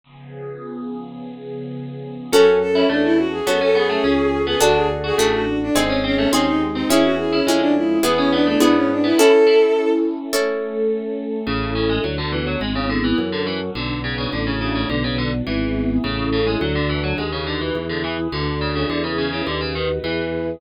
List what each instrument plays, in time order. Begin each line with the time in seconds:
0.04 pad 2 (warm) C#3 F3 B3 G#4
2.32 drawbar organ F#2, harpsichord C#4, orchestral harp C#4 F#4 A4, pad 2 (warm) C#4 F#4 A4, violin A4
2.60 violin A4
2.73 violin C#4, harpsichord E4
2.89 drawbar organ E2, harpsichord A3, violin D4
3.04 violin E4
3.18 violin F#4
3.31 violin G#4
3.45 drawbar organ F#2, harpsichord B3, pad 2 (warm) C#4 A4 C#5, orchestral harp C#4 F#4 A4, violin A4
3.61 harpsichord C#4, violin A4
3.75 harpsichord B3, violin G#4
3.90 harpsichord A3
4.04 drawbar organ C#2, harpsichord C#4
4.47 harpsichord B3, violin G#4
4.60 drawbar organ D2, orchestral harp D4 F#4 A4, pad 2 (warm) D4 F#4 A4, harpsichord D4, violin F#4
4.76 violin G#4
5.04 harpsichord F#4, violin G#4
5.18 drawbar organ A1, harpsichord A3, pad 2 (warm) D4 A4 D5, orchestral harp D4 F#4 A4, violin G#4
5.33 violin F#4
5.62 violin D4
5.74 drawbar organ G#1, violin C4, harpsichord C4, orchestral harp C4 D#4 G#4, pad 2 (warm) C4 D#4 G#4
5.90 harpsichord C#4
6.04 harpsichord C4, violin C#4
6.16 harpsichord A3, violin C#4
6.32 drawbar organ D#2, pad 2 (warm) G#3 C4 G#4, harpsichord C4, orchestral harp C4 D#4 G#4, violin C#4
6.47 violin D#4
6.74 harpsichord C4, violin D#4
6.89 drawbar organ E2, pad 2 (warm) C#4 E4 G#4, harpsichord C#4, orchestral harp C#4 E4 G#4, violin E4
7.03 violin F#4
7.18 violin G#4
7.32 violin C#4, harpsichord E4
7.46 drawbar organ F2, pad 2 (warm) G#3 C#4 G#4, harpsichord G#3, orchestral harp C#4 E4 G#4
7.60 violin D4
7.76 violin E4
8.03 drawbar organ E2, orchestral harp B3 E4 G#4, pad 2 (warm) B3 E4 G#4, harpsichord B3, violin G#4
8.17 violin C#4, harpsichord C#4
8.32 harpsichord B3, violin D4
8.45 harpsichord A3, violin D4
8.60 drawbar organ G#2, orchestral harp B3 E4 G#4, pad 2 (warm) B3 G#4 B4, harpsichord B3, violin D4
8.76 violin C#4
8.91 violin D4
9.04 harpsichord B3, violin E4
9.17 pad 2 (warm) C#4 E4 A4, orchestral harp C#4 E4 A4, harpsichord E4, violin A4
9.47 harpsichord E4
10.33 pad 2 (warm) A3 C#4 A4, orchestral harp C#4 E4 A4
11.46 drawbar organ A1, harpsichord C#3, pad 2 (warm) C#4 E4 A4
11.75 harpsichord C#3
11.90 harpsichord G#3
12.03 drawbar organ D2, harpsichord F#3, pad 2 (warm) B3 D4 F#4
12.18 harpsichord D3
12.32 harpsichord E3
12.47 harpsichord F#3
12.61 drawbar organ G#1, harpsichord G#3, pad 2 (warm) B3 E4 G#4
12.75 harpsichord C#3
12.90 harpsichord D3
13.04 harpsichord E3
13.18 drawbar organ F#2, pad 2 (warm) C#4 F#4 A4
13.32 harpsichord D3
13.47 harpsichord E3
13.75 drawbar organ B1, harpsichord D3, pad 2 (warm) B3 D4 F#4
14.04 harpsichord C#3
14.18 harpsichord C#3
14.32 drawbar organ A1, harpsichord D3, pad 2 (warm) A3 D4 F#4
14.47 harpsichord C#3
14.61 harpsichord C#3
14.75 harpsichord C#3
14.89 drawbar organ B1, harpsichord D3, pad 2 (warm) B3 D4 F#4
15.04 harpsichord C#3
15.18 harpsichord D3
15.46 drawbar organ G#1, harpsichord E3, pad 2 (warm) B3 E4 G#4
16.04 drawbar organ A1, harpsichord C#3, pad 2 (warm) C#4 E4 A4
16.33 harpsichord C#3
16.47 harpsichord G#3
16.61 drawbar organ D2, harpsichord F#3, pad 2 (warm) D4 F#4 A4
16.75 harpsichord D3
16.89 harpsichord E3
17.04 harpsichord F#3
17.18 drawbar organ D#2, harpsichord G#3, pad 2 (warm) D#4 F#4 B4
17.32 harpsichord C#3
17.47 harpsichord D3
17.61 harpsichord E3
17.75 drawbar organ E2, pad 2 (warm) E4 G#4 B4
17.89 harpsichord D3
18.04 harpsichord E3
18.32 drawbar organ D2, harpsichord D3, pad 2 (warm) D4 F#4 A4
18.61 harpsichord C#3
18.75 harpsichord C#3
18.90 drawbar organ E2, harpsichord D3, pad 2 (warm) E4 G#4 B4
19.04 harpsichord C#3
19.18 harpsichord C#3
19.33 harpsichord C#3
19.47 drawbar organ D#2, harpsichord D3, pad 2 (warm) D#4 F#4 B4
19.61 harpsichord C#3
19.75 harpsichord D#3
20.04 drawbar organ E2, harpsichord E3, pad 2 (warm) E4 G#4 B4